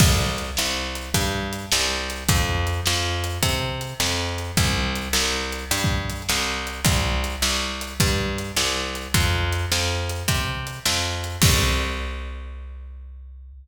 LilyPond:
<<
  \new Staff \with { instrumentName = "Electric Bass (finger)" } { \clef bass \time 12/8 \key c \major \tempo 4. = 105 c,4. c,4. g,4. c,4. | f,4. f,4. c4. f,4. | c,4. c,4. g,4. c,4. | c,4. c,4. g,4. c,4. |
f,4. f,4. c4. f,4. | c,1. | }
  \new DrumStaff \with { instrumentName = "Drums" } \drummode { \time 12/8 <cymc bd>4 hh8 sn4 hh8 <hh bd>4 hh8 sn4 hh8 | <hh bd>4 hh8 sn4 hh8 <hh bd>4 hh8 sn4 hh8 | <hh bd>4 hh8 sn4 hh8 \tuplet 3/2 { hh16 r16 bd16 r16 r16 r16 hh16 r16 hh16 } sn4 hh8 | <hh bd>4 hh8 sn4 hh8 <hh bd>4 hh8 sn4 hh8 |
<hh bd>4 hh8 sn4 hh8 <hh bd>4 hh8 sn4 hh8 | <cymc bd>4. r4. r4. r4. | }
>>